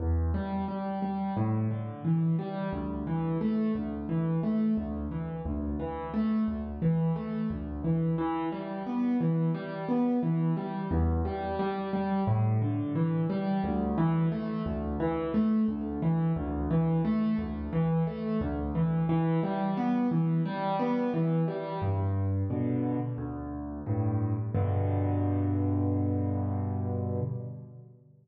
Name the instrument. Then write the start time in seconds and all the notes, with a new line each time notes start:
acoustic grand piano
0.00 E2
0.34 G3
0.68 G3
1.02 G3
1.37 A2
1.71 D3
2.05 E3
2.39 G3
2.73 D2
3.07 E3
3.41 A3
3.75 D2
4.09 E3
4.43 A3
4.77 D2
5.11 E3
5.45 D2
5.79 E3
6.14 A3
6.48 D2
6.82 E3
7.16 A3
7.50 D2
7.84 E3
8.18 E3
8.52 G3
8.86 B3
9.20 E3
9.54 G3
9.88 B3
10.23 E3
10.57 G3
10.91 E2
11.25 G3
11.59 G3
11.93 G3
12.27 A2
12.62 D3
12.95 E3
13.30 G3
13.64 D2
13.98 E3
14.32 A3
14.66 D2
15.00 E3
15.34 A3
15.68 D2
16.02 E3
16.36 D2
16.71 E3
17.05 A3
17.38 D2
17.73 E3
18.07 A3
18.41 D2
18.75 E3
19.09 E3
19.43 G3
19.77 B3
20.11 E3
20.45 G3
20.79 B3
21.14 E3
21.48 G3
21.82 G2
22.50 B2 D3
23.18 D2
23.86 G2 A2
24.55 G2 B2 D3